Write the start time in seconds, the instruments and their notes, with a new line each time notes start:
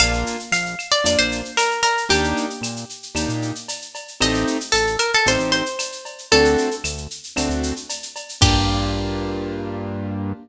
0.00 synth bass 1 A#1, acoustic grand piano A#3 D4 F4, acoustic guitar (steel) F5, cowbell, claves, shaker
0.13 shaker
0.26 shaker
0.39 shaker
0.52 synth bass 1 A#1, acoustic guitar (steel) F5, shaker
0.66 shaker
0.79 claves, shaker
0.92 acoustic guitar (steel) D5, shaker
1.04 synth bass 1 F2, acoustic grand piano A#3 D4 F4, acoustic guitar (steel) D5, cowbell, shaker
1.19 synth bass 1 A#1, acoustic guitar (steel) C5, shaker
1.32 shaker
1.45 shaker
1.57 acoustic guitar (steel) A#4, cowbell, claves, shaker
1.71 shaker
1.83 acoustic guitar (steel) A#4, cowbell, shaker
1.97 shaker
2.09 synth bass 1 D#2, acoustic grand piano A#3 D4 D#4 G4, acoustic guitar (steel) G4, cowbell, shaker
2.24 shaker
2.37 shaker
2.50 shaker
2.61 synth bass 1 A#2, claves, shaker
2.76 shaker
2.89 shaker
3.03 shaker
3.15 synth bass 1 D#2, acoustic grand piano A#3 D4 D#4 G4, cowbell, claves, shaker
3.29 synth bass 1 A#2, shaker
3.42 shaker
3.55 shaker
3.68 cowbell, shaker
3.82 shaker
3.95 cowbell, shaker
4.08 shaker
4.21 synth bass 1 A1, acoustic grand piano A3 C4 D#4 G4, acoustic guitar (steel) D#5, cowbell, claves, shaker
4.34 shaker
4.47 shaker
4.61 shaker
4.72 synth bass 1 A1, acoustic guitar (steel) A4, shaker
4.87 shaker
4.99 acoustic guitar (steel) A#4, claves, shaker
5.13 acoustic guitar (steel) A4, shaker
5.26 synth bass 1 A1, acoustic grand piano A3 C4 D#4 G4, acoustic guitar (steel) C5, cowbell, shaker
5.39 synth bass 1 A1, shaker
5.52 acoustic guitar (steel) C5, shaker
5.66 shaker
5.79 cowbell, claves, shaker
5.92 shaker
6.05 cowbell, shaker
6.18 shaker
6.32 synth bass 1 D2, acoustic grand piano A3 C4 D4 F#4, acoustic guitar (steel) A4, cowbell, shaker
6.45 shaker
6.58 shaker
6.71 shaker
6.84 synth bass 1 D2, claves, shaker
6.97 shaker
7.11 shaker
7.24 shaker
7.36 synth bass 1 D2, acoustic grand piano A3 C4 D4 F#4, cowbell, claves, shaker
7.49 synth bass 1 D2, shaker
7.63 shaker
7.76 shaker
7.89 cowbell, shaker
8.03 shaker
8.16 cowbell, shaker
8.29 shaker
8.41 synth bass 1 G2, acoustic grand piano A#3 D4 F4 G4, acoustic guitar (steel) G4, kick, crash